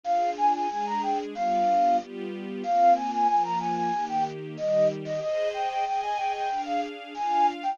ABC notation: X:1
M:4/4
L:1/16
Q:1/4=93
K:Cm
V:1 name="Flute"
f2 a a a b g z f4 z4 | f2 a a a b a a2 g z2 e2 z e | e2 g g g a g g2 f z2 a2 z g |]
V:2 name="String Ensemble 1"
[DFA]4 [A,DA]4 [G,=B,DF]4 [G,B,FG]4 | [B,CF]4 [F,B,F]4 [E,B,G]4 [E,G,G]4 | [Ace]4 [Aea]4 [DAf]4 [DFf]4 |]